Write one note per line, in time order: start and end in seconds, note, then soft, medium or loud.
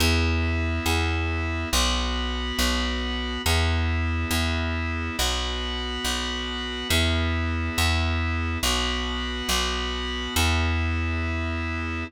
0.00 0.80 E2 loud
0.00 1.69 B3 loud
0.00 1.69 E4 loud
0.86 1.65 E2 medium
1.72 2.52 B1 loud
1.72 3.42 B3 loud
1.72 3.42 F#4 medium
2.59 3.38 B1 medium
3.46 4.25 E2 loud
3.46 5.16 B3 loud
3.46 5.16 E4 medium
4.31 5.10 E2 medium
5.18 5.98 B1 medium
5.18 6.88 B3 loud
5.18 6.88 F#4 loud
6.04 6.84 B1 medium
6.89 7.70 E2 loud
6.89 8.58 B3 loud
6.89 8.58 E4 medium
7.78 8.57 E2 medium
8.63 9.42 B1 medium
8.63 10.34 B3 loud
8.63 10.34 F#4 loud
9.49 10.28 B1 medium
10.36 12.04 E2 loud
10.36 12.04 B3 loud
10.36 12.04 E4 loud